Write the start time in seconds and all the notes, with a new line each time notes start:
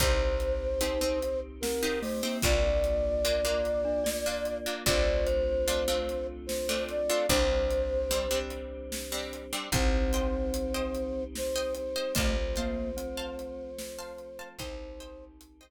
0.00 C2 C4 D#4 G4 C5, kick, closed hi-hat
0.40 closed hi-hat
0.81 C4 D#4 G4, closed hi-hat
1.01 C4 D#4 G4
1.22 closed hi-hat
1.61 C4 A#4, snare
1.83 C4 D#4 G4
2.02 A3 C5, open hi-hat
2.23 A#3 C4 D#4 G4
2.42 C2 A#3 D4 F4 D5, kick, closed hi-hat
2.84 closed hi-hat
3.25 A#3 D4 F4, closed hi-hat
3.45 A#3 D4 F4
3.65 closed hi-hat
3.85 D4
4.04 D5, snare
4.26 A#3 D4 F4
4.45 closed hi-hat
4.66 A#3 D4 F4
4.86 C2 A3 C4 D4 F4 C5 D5, kick, closed hi-hat
5.27 C5, closed hi-hat
5.68 A3 C4 D4 F4, closed hi-hat
5.88 A3 C4 D4 F4
6.09 closed hi-hat
6.46 C5, snare
6.69 A3 C4 D4 F4
6.89 D5, closed hi-hat
7.09 A3 C4 D4 F4
7.29 C2 G3 C4 D4 C5, kick, closed hi-hat
7.70 closed hi-hat
8.11 G3 C4 D4, closed hi-hat
8.31 G3 C4 D4
8.50 closed hi-hat
8.92 snare
9.12 G3 C4 D4
9.33 closed hi-hat
9.53 G3 C4 D4
9.72 C2 G3 C4 D#4 C5 D#5 G5, kick, closed hi-hat
10.13 C5 D#5 G5, closed hi-hat
10.54 closed hi-hat
10.74 C5 D#5 G5
10.95 closed hi-hat
11.35 C5, snare
11.56 C5 D#5 G5
11.74 C5, closed hi-hat
11.96 C5 D#5 G5
12.15 C2 F3 A3 C4 C5 F5 A5, kick, closed hi-hat
12.56 A#3 C5 F5 A5, closed hi-hat
12.97 C4, closed hi-hat
13.17 C5 F5 A5
13.39 closed hi-hat
13.79 snare
13.98 C5 F5 A5
14.18 closed hi-hat
14.39 C5 F5 A5
14.59 C2 D#3 G3 C4 D#4 C5 D#5 G5, kick, closed hi-hat
15.00 C5 D#5 G5, closed hi-hat
15.41 closed hi-hat
15.61 C5 D#5 G5